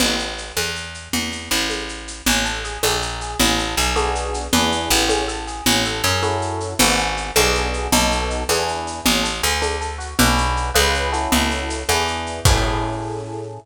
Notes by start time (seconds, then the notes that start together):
0.00 A1, crash, low conga, shaker
0.19 shaker
0.38 shaker
0.57 E2, high conga, shaker
0.75 shaker
0.94 shaker
1.13 E2, low conga, shaker
1.32 low conga, shaker
1.51 A1, shaker
1.70 high conga, shaker
1.89 shaker
2.08 shaker
2.26 A1 C#4, low conga, shaker
2.45 A4, shaker
2.64 G#4, shaker
2.83 A#1 D4, high conga, shaker
3.02 A#4, shaker
3.21 G#4, shaker
3.39 A1 C#4, low conga, shaker
3.58 A4, shaker
3.77 B1 G#4, shaker
3.96 B3 D4 F#4 G#4, high conga, shaker
4.15 shaker
4.34 shaker
4.53 E2 B3 D4 E4 G#4, low conga, shaker
4.72 shaker
4.90 A1, shaker
5.08 C#4, high conga, shaker
5.28 A4, shaker
5.47 G#4, shaker
5.66 A1 C#4, low conga, shaker
5.85 A4, shaker
6.04 F#2 G#4, shaker
6.23 C#4 E4 F#4 A4, high conga, shaker
6.42 shaker
6.60 shaker
6.79 G#1 B3 D4 F#4 G#4, low conga, shaker
6.98 shaker
7.17 shaker
7.36 B1 B3 D4 F#4 G#4, high conga, shaker
7.55 shaker
7.74 shaker
7.92 B1 B3 D#4 F#4 A4, low conga, shaker
8.11 shaker
8.30 shaker
8.49 E2 B3 D4 E4 G#4, high conga, shaker
8.68 shaker
8.87 shaker
9.05 A1 C#4, low conga, shaker
9.23 A4, shaker
9.43 D2 G#4, shaker
9.61 D4, high conga, shaker
9.81 A4, shaker
9.98 F#4, shaker
10.19 B1 D4 F#4 G#4 B4, low conga, shaker
10.38 shaker
10.57 shaker
10.74 C#2 C#4 F4 G#4 B4, high conga, shaker
10.94 shaker
11.12 C#4 E4 F#4 A4, shaker
11.32 C#2, low conga, shaker
11.51 shaker
11.70 shaker
11.89 E2 B3 D4 E4 G#4, high conga, shaker
12.08 shaker
12.26 shaker
12.45 A2 C#4 E4 G#4 A4, kick, crash